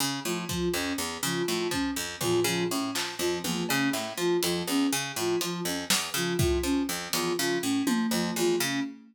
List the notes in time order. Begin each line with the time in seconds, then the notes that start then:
0.00 C#3
0.25 A2 F3
0.49 F3, kick
0.74 F2 C#4
0.98 E2
1.23 C#3 F3
1.47 A2 F3
1.71 F3 C#4, kick
1.96 F2
2.21 E2 F3, floor tom
2.44 C#3 F3
2.70 A2 C#4
2.95 F3, clap
3.19 F2 F3, cowbell
3.44 E2 F3, high tom
3.68 C#3 C#4, cowbell
3.93 A2, clap
4.18 F3
4.42 F2 F3, closed hi-hat
4.68 E2 C#4
4.93 C#3
5.16 A2 F3
5.41 F3, closed hi-hat
5.65 F2 C#4
5.90 E2, snare
6.14 C#3 F3
6.39 A2 F3, kick
6.63 F3 C#4
6.89 F2
7.13 E2 F3, closed hi-hat
7.37 C#3 F3
7.62 A2 C#4
7.87 F3, high tom
8.11 F2 F3
8.36 E2 F3, cowbell
8.60 C#3 C#4